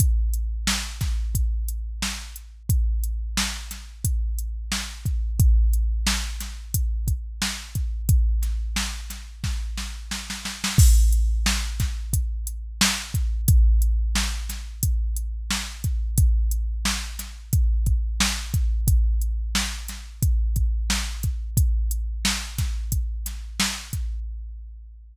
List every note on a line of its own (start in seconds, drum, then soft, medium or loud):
0.00 kick medium
0.00 closed hi-hat loud
0.34 closed hi-hat medium
0.67 snare loud
1.01 kick medium
1.01 snare soft
1.01 closed hi-hat medium
1.35 kick medium
1.35 closed hi-hat medium
1.69 closed hi-hat medium
2.02 snare medium
2.36 closed hi-hat medium
2.69 kick medium
2.69 closed hi-hat medium
3.04 closed hi-hat medium
3.37 snare medium
3.71 snare soft
3.71 closed hi-hat medium
4.04 kick medium
4.04 closed hi-hat medium
4.38 closed hi-hat medium
4.72 snare medium
5.05 kick medium
5.05 closed hi-hat soft
5.40 kick loud
5.40 closed hi-hat medium
5.73 closed hi-hat medium
6.07 snare loud
6.40 snare soft
6.40 closed hi-hat medium
6.74 kick medium
6.74 closed hi-hat loud
7.08 kick medium
7.08 closed hi-hat medium
7.42 snare medium
7.75 kick medium
7.75 closed hi-hat medium
8.09 kick loud
8.09 closed hi-hat medium
8.43 snare soft
8.43 closed hi-hat medium
8.76 snare medium
9.10 snare soft
9.10 closed hi-hat medium
9.44 kick medium
9.44 snare medium
9.78 snare medium
10.11 snare medium
10.30 snare medium
10.45 snare medium
10.64 snare medium
10.78 kick loud
10.78 crash medium
11.12 closed hi-hat medium
11.46 snare loud
11.80 kick medium
11.80 snare medium
11.80 closed hi-hat medium
12.13 kick medium
12.13 closed hi-hat medium
12.47 closed hi-hat medium
12.81 snare loud
13.14 kick medium
13.14 closed hi-hat medium
13.48 kick loud
13.48 closed hi-hat loud
13.82 closed hi-hat medium
14.15 snare medium
14.49 snare soft
14.49 closed hi-hat medium
14.83 kick medium
14.83 closed hi-hat loud
15.16 closed hi-hat medium
15.51 snare medium
15.84 kick medium
15.84 closed hi-hat medium
16.18 kick medium
16.18 closed hi-hat medium
16.51 closed hi-hat medium
16.85 snare medium
17.19 snare soft
17.19 closed hi-hat medium
17.53 kick medium
17.53 closed hi-hat medium
17.86 kick medium
17.86 closed hi-hat medium
18.20 snare loud
18.54 kick medium
18.54 closed hi-hat medium
18.88 kick medium
18.88 closed hi-hat medium
19.21 closed hi-hat medium
19.55 snare medium
19.88 snare soft
19.88 closed hi-hat medium
20.22 kick medium
20.22 closed hi-hat medium
20.56 kick medium
20.56 closed hi-hat medium
20.90 snare medium
21.23 kick medium
21.23 closed hi-hat medium
21.57 kick medium
21.57 closed hi-hat medium
21.91 closed hi-hat medium
22.25 snare loud
22.58 kick medium
22.58 snare medium
22.58 closed hi-hat medium
22.92 kick medium
22.92 closed hi-hat medium
23.26 snare soft
23.26 closed hi-hat medium
23.60 snare loud
23.93 kick medium
23.93 closed hi-hat medium